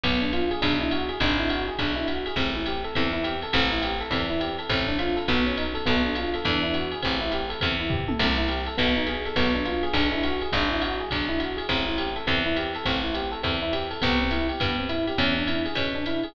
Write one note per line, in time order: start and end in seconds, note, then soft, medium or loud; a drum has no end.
0.03 0.53 B1 medium
0.03 0.20 B3 medium
0.03 kick medium
0.03 ride medium
0.22 0.31 D4 medium
0.33 0.49 F4 medium
0.33 hi-hat pedal medium
0.33 ride medium
0.51 0.61 G#4 medium
0.51 ride medium
0.61 1.12 B1 medium
0.61 0.78 D4 medium
0.61 kick medium
0.61 ride loud
0.81 0.91 E4 medium
0.91 1.08 F#4 medium
0.91 hi-hat pedal medium
0.91 ride medium
1.09 1.19 G#4 medium
1.09 ride medium
1.20 1.70 G#1 loud
1.20 1.37 D4 medium
1.20 kick medium
1.20 ride medium
1.38 1.48 E4 medium
1.49 1.66 F#4 medium
1.49 hi-hat pedal medium
1.49 ride medium
1.68 1.78 G#4 medium
1.79 2.28 B1 medium
1.79 1.95 D4 medium
1.79 kick medium
1.79 ride medium
1.96 2.06 E4 medium
2.08 2.24 F#4 medium
2.08 hi-hat pedal medium
2.08 ride medium
2.26 2.37 G#4 medium
2.26 ride medium
2.36 2.85 A1 medium
2.36 2.53 C4 medium
2.36 kick medium
2.36 ride medium
2.55 2.65 E4 medium
2.66 2.83 G4 medium
2.66 hi-hat pedal medium
2.66 ride medium
2.84 2.94 A4 medium
2.84 ride medium
2.95 3.46 E2 medium
2.95 3.12 C4 medium
2.95 kick medium
2.95 ride medium
3.13 3.23 E4 medium
3.24 3.40 G4 medium
3.24 hi-hat pedal medium
3.24 ride medium
3.42 3.53 A4 medium
3.42 ride medium
3.53 4.03 A1 loud
3.53 3.70 C4 medium
3.53 kick medium
3.53 crash medium
3.53 ride medium
3.72 3.82 E4 medium
3.82 3.98 G4 medium
3.82 hi-hat pedal medium
3.82 ride medium
4.00 4.10 A4 medium
4.00 ride medium
4.11 4.60 E2 medium
4.11 4.27 C4 medium
4.11 kick medium
4.11 ride medium
4.30 4.40 E4 medium
4.40 4.56 G4 medium
4.40 hi-hat pedal medium
4.40 ride medium
4.59 4.69 A4 medium
4.59 ride medium
4.69 5.19 A1 medium
4.69 4.86 C4 medium
4.69 kick medium
4.69 ride medium
4.88 4.98 D4 medium
4.99 5.15 F4 medium
4.99 hi-hat pedal medium
4.99 ride medium
5.16 5.26 A4 medium
5.16 ride medium
5.28 5.78 B1 medium
5.28 5.44 B3 medium
5.28 kick soft
5.28 ride medium
5.46 5.56 C#4 medium
5.46 ride medium
5.57 5.74 D#4 medium
5.57 hi-hat pedal medium
5.57 ride medium
5.74 5.84 A4 medium
5.74 ride medium
5.86 6.36 B1 medium
5.86 6.02 B3 medium
5.86 kick medium
5.86 ride medium
6.05 6.15 D4 medium
6.15 6.32 F4 medium
6.15 hi-hat pedal medium
6.15 ride medium
6.34 6.45 A4 medium
6.34 ride medium
6.45 6.95 E2 medium
6.45 6.62 D4 medium
6.45 kick medium
6.45 ride medium
6.63 6.73 E4 medium
6.74 6.90 F#4 medium
6.74 hi-hat pedal medium
6.74 ride medium
6.91 7.02 G#4 medium
6.91 ride medium
7.02 7.54 A1 medium
7.02 7.19 C4 medium
7.02 kick medium
7.02 ride medium
7.21 7.31 E4 medium
7.31 7.48 G4 medium
7.31 hi-hat pedal medium
7.31 ride medium
7.49 7.59 A4 medium
7.49 ride medium
7.61 8.12 E2 medium
7.61 7.77 C4 medium
7.61 kick medium
7.61 ride loud
7.80 7.90 E4 medium
7.90 8.06 G4 medium
7.90 kick medium
7.90 floor tom medium
8.08 8.18 A4 medium
8.08 high tom medium
8.19 8.69 C2 medium
8.19 8.35 C4 medium
8.19 kick soft
8.19 crash medium
8.19 ride medium
8.38 8.48 E4 medium
8.48 8.65 G4 medium
8.48 hi-hat pedal medium
8.48 ride medium
8.66 8.77 A4 medium
8.66 ride medium
8.77 9.28 B1 medium
8.77 8.94 B3 medium
8.77 kick medium
8.77 ride medium
8.96 9.06 D#4 medium
9.06 9.23 G#4 medium
9.06 hi-hat pedal medium
9.06 ride medium
9.25 9.36 A4 medium
9.25 ride medium
9.36 9.85 B1 medium
9.36 9.53 B3 medium
9.36 kick medium
9.36 ride medium
9.55 9.65 D4 medium
9.65 9.82 F4 medium
9.65 hi-hat pedal medium
9.65 ride medium
9.83 9.93 G#4 medium
9.83 ride medium
9.93 10.43 B1 medium
9.93 10.10 D4 medium
9.93 kick medium
9.93 ride loud
10.12 10.22 E4 medium
10.23 10.40 F#4 medium
10.23 hi-hat pedal medium
10.23 ride medium
10.41 10.52 G#4 medium
10.41 ride medium
10.52 11.02 G#1 loud
10.52 10.69 D4 medium
10.52 kick medium
10.52 ride medium
10.70 10.80 E4 medium
10.82 10.98 F#4 medium
10.82 hi-hat pedal medium
10.82 ride medium
11.00 11.10 G#4 medium
11.11 11.61 B1 medium
11.11 11.28 D4 medium
11.11 kick medium
11.11 ride medium
11.29 11.39 E4 medium
11.39 11.56 F#4 medium
11.39 hi-hat pedal medium
11.39 ride medium
11.57 11.67 G#4 medium
11.57 ride medium
11.69 12.18 A1 medium
11.69 11.85 C4 medium
11.69 kick medium
11.69 ride medium
11.87 11.97 E4 medium
11.98 12.14 G4 medium
11.98 hi-hat pedal medium
11.98 ride medium
12.16 12.26 A4 medium
12.16 ride medium
12.27 12.77 E2 medium
12.27 12.43 C4 medium
12.27 kick medium
12.27 ride medium
12.46 12.56 E4 medium
12.56 12.73 G4 medium
12.56 hi-hat pedal medium
12.56 ride medium
12.75 12.85 A4 medium
12.75 ride medium
12.85 13.35 A1 medium
12.85 13.02 C4 medium
12.85 kick medium
12.85 ride medium
13.03 13.13 E4 medium
13.14 13.30 G4 medium
13.14 hi-hat pedal medium
13.14 ride medium
13.32 13.42 A4 medium
13.32 ride medium
13.43 13.93 E2 medium
13.43 13.59 C4 medium
13.43 kick medium
13.43 ride medium
13.62 13.72 E4 medium
13.73 13.89 G4 medium
13.73 hi-hat pedal medium
13.73 ride medium
13.91 14.01 A4 medium
13.91 ride medium
14.02 14.52 C2 loud
14.02 14.18 B3 medium
14.02 kick medium
14.02 ride medium
14.21 14.31 C4 medium
14.31 14.47 E4 medium
14.31 hi-hat pedal medium
14.31 ride medium
14.49 14.59 G4 medium
14.49 ride medium
14.60 15.10 G2 medium
14.60 14.76 B3 medium
14.60 kick medium
14.60 ride medium
14.78 14.88 C4 medium
14.89 15.05 E4 medium
14.89 hi-hat pedal medium
14.89 ride medium
15.07 15.17 G4 medium
15.07 ride medium
15.18 15.68 E2 medium
15.18 15.34 C#4 medium
15.18 kick soft
15.18 ride medium
15.37 15.47 D4 medium
15.47 15.64 E4 medium
15.47 hi-hat pedal medium
15.47 ride medium
15.65 15.76 G#4 medium
15.65 ride medium
15.75 16.25 B2 medium
15.75 15.93 C#4 medium
15.75 kick soft
15.75 ride medium
15.95 16.05 D4 medium
16.06 16.23 E4 medium
16.06 hi-hat pedal medium
16.06 ride medium
16.23 16.34 G#4 medium
16.23 ride medium